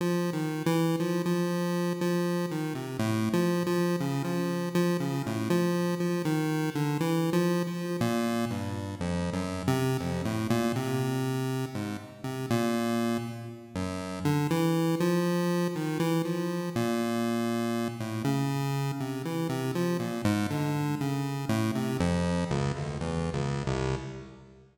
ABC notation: X:1
M:4/4
L:1/16
Q:1/4=60
K:none
V:1 name="Lead 1 (square)" clef=bass
(3F,2 _E,2 =E,2 F, F,3 F,2 _E, C, (3A,,2 F,2 F,2 | _D, F,2 F, D, A,, F,2 F, _E,2 =D, (3=E,2 F,2 F,2 | _B,,2 G,,2 (3F,,2 _G,,2 C,2 F,, A,, B,, C,4 _A,, | z C, _B,,3 z2 _G,,2 D, E,2 F,3 _E, |
E, F,2 _B,,5 A,, _D,3 C, E, C, F, | _B,, _A,, D,2 _D,2 =A,, C, F,,2 _D,, =D,, (3E,,2 _D,,2 C,,2 |]